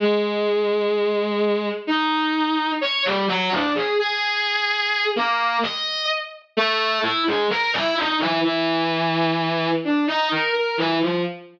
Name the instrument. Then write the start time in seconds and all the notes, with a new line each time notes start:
violin
0.00 G#3
1.87 D#4
2.81 C#5
3.05 G3
3.28 F#3
3.52 D4
3.75 G#4
3.99 G#4
5.16 A#3
5.63 D#5
6.57 A3
7.03 E4
7.27 G#3
7.50 A#4
7.74 E4
7.97 D#4
8.20 E3
8.44 E3
9.84 D4
10.07 D#4
10.31 A#4
10.55 A#4
10.78 E3
11.01 F3